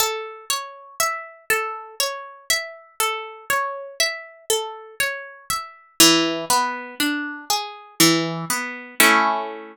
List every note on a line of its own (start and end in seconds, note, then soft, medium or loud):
0.00 0.45 A4 medium
0.50 0.95 C#5 medium
1.00 1.45 E5 medium
1.50 1.95 A4 medium
2.00 2.45 C#5 medium
2.50 2.95 E5 medium
3.00 3.45 A4 medium
3.50 3.95 C#5 medium
4.00 4.45 E5 medium
4.50 4.95 A4 medium
5.00 5.45 C#5 medium
5.50 5.95 E5 medium
6.00 6.45 E3 medium
6.50 6.95 B3 medium
7.00 7.45 D4 medium
7.50 7.95 G#4 medium
8.00 8.45 E3 medium
8.50 8.95 B3 medium
9.00 9.76 A3 loud
9.00 9.76 C#4 loud
9.00 9.76 E4 loud